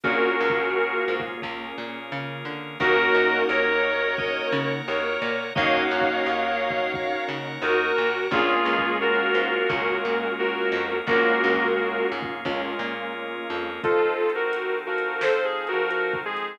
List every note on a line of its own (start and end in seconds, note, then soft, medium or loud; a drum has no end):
0.04 0.33 A#1 medium
0.04 1.41 A#3 medium
0.04 2.53 A#3 medium
0.04 1.41 C#4 medium
0.04 0.37 C#4 medium
0.04 2.53 C#4 loud
0.04 1.41 F4 medium
0.04 2.53 F4 medium
0.04 1.21 F#4 medium
0.04 1.41 G#4 loud
0.04 2.53 G#4 loud
0.04 1.21 A#4 medium
0.04 kick loud
0.40 0.99 C#2 medium
0.40 1.05 C#4 medium
0.50 kick medium
1.08 1.37 G#2 medium
1.20 kick medium
1.42 1.72 C#2 medium
1.42 2.78 A#3 medium
1.42 2.78 C#4 medium
1.42 2.78 G#4 medium
1.42 2.78 A#4 medium
1.42 kick medium
1.78 2.11 A#2 medium
2.12 2.43 C#3 medium
2.45 2.76 D3 medium
2.80 3.09 D#2 loud
2.80 5.29 A#3 loud
2.80 5.29 C#4 loud
2.80 5.29 D#4 loud
2.80 5.29 F#4 loud
2.80 3.43 F#4 medium
2.80 3.40 A#4 medium
2.80 3.43 A#4 loud
2.80 4.16 A#4 medium
2.80 4.16 C#5 loud
2.80 4.17 D#5 loud
2.80 4.16 F#5 medium
2.80 kick loud
3.14 3.44 F#2 medium
3.49 4.37 D#2 loud
3.49 4.71 A#4 medium
3.49 4.15 A#4 medium
3.49 4.71 C#5 medium
4.17 5.53 A#4 loud
4.17 5.53 C#5 loud
4.17 4.49 D#5 medium
4.17 5.53 F#5 loud
4.17 5.53 A#5 loud
4.17 kick loud
4.52 4.82 C#3 loud
4.88 5.17 D#2 medium
4.88 5.44 A#4 medium
4.88 5.44 C#5 medium
5.22 5.51 A#2 medium
5.55 5.87 D#2 loud
5.55 8.04 A#3 loud
5.55 8.04 C#4 loud
5.55 8.04 D#4 loud
5.55 8.04 F#4 loud
5.55 6.92 A#4 loud
5.55 6.92 C#5 loud
5.55 7.23 C#5 medium
5.55 5.83 D#5 medium
5.55 6.92 D#5 loud
5.55 7.23 F5 medium
5.55 6.92 F#5 loud
5.55 kick loud
5.91 6.21 F#2 medium
6.01 kick medium
6.26 7.14 D#2 medium
6.70 kick medium
6.94 8.31 A#4 medium
6.94 8.31 C#5 loud
6.94 8.31 F#5 loud
6.94 8.31 A#5 loud
6.94 kick loud
7.28 7.58 C#3 medium
7.62 7.91 D#2 loud
7.62 7.92 D#4 medium
7.62 8.24 F#4 medium
7.62 8.24 A#4 medium
7.98 8.27 A#2 medium
8.31 8.60 A#1 loud
8.31 9.57 G#3 loud
8.31 9.68 A#3 loud
8.31 9.57 A#3 loud
8.31 9.68 C#4 loud
8.31 9.57 C#4 loud
8.31 9.68 F4 loud
8.31 8.97 F4 medium
8.31 8.89 F4 medium
8.31 9.57 F4 loud
8.31 9.68 G#4 loud
8.31 8.97 G#4 medium
8.31 kick loud
8.65 9.24 C#2 medium
8.79 kick medium
9.01 9.69 F4 medium
9.01 10.32 F#4 medium
9.01 10.32 A#4 medium
9.35 9.64 G#2 medium
9.69 9.99 C#2 medium
9.69 10.94 G#3 loud
9.69 10.94 A#3 medium
9.69 11.06 A#3 loud
9.69 9.96 C#4 medium
9.69 10.94 C#4 medium
9.69 11.06 C#4 loud
9.69 10.94 F4 medium
9.69 11.06 G#4 medium
9.69 11.06 A#4 loud
9.69 kick loud
10.05 10.64 A#2 medium
10.39 10.96 F#4 medium
10.39 10.96 A#4 medium
10.72 11.01 F2 medium
11.07 11.36 A#1 loud
11.07 12.33 G#3 loud
11.07 12.44 A#3 loud
11.07 11.67 A#3 medium
11.07 12.33 A#3 loud
11.07 12.44 C#4 medium
11.07 12.33 C#4 loud
11.07 12.44 F4 medium
11.07 12.33 F4 loud
11.07 12.07 F#4 medium
11.07 12.44 G#4 loud
11.07 12.07 A#4 medium
11.07 kick loud
11.44 12.02 C#2 loud
11.54 kick medium
12.12 12.41 G#2 medium
12.22 kick medium
12.45 12.74 C#2 loud
12.45 13.70 G#3 medium
12.45 13.82 A#3 medium
12.45 13.70 A#3 medium
12.45 13.82 C#4 loud
12.45 13.70 C#4 medium
12.45 13.70 F4 loud
12.45 13.82 G#4 loud
12.45 13.82 A#4 loud
12.45 kick medium
12.79 13.38 A#2 medium
13.50 13.79 F2 medium
13.83 16.56 F3 medium
13.83 14.14 F3 medium
13.83 16.56 C4 medium
13.83 16.56 D#4 medium
13.83 14.31 F4 medium
13.83 14.33 F4 medium
13.83 16.56 A4 medium
13.83 14.31 A4 medium
13.83 14.33 C5 medium
13.83 14.33 D#5 medium
13.83 14.33 A5 medium
13.83 kick loud
13.83 closed hi-hat medium
14.30 closed hi-hat medium
14.35 14.79 F#4 medium
14.35 14.79 A#4 medium
14.53 closed hi-hat loud
14.86 15.68 F3 medium
14.86 15.20 F#4 medium
14.86 15.20 A#4 medium
14.98 closed hi-hat medium
15.21 15.44 A4 medium
15.21 15.44 C5 medium
15.21 snare loud
15.45 15.67 G#4 medium
15.67 15.90 F#4 medium
15.67 15.90 A#4 medium
15.67 closed hi-hat medium
15.73 16.15 F3 medium
15.90 16.19 F#4 medium
15.90 16.19 A#4 medium
15.90 closed hi-hat medium
16.14 kick medium
16.25 16.57 G#3 medium
16.25 16.57 G#4 medium
16.37 closed hi-hat medium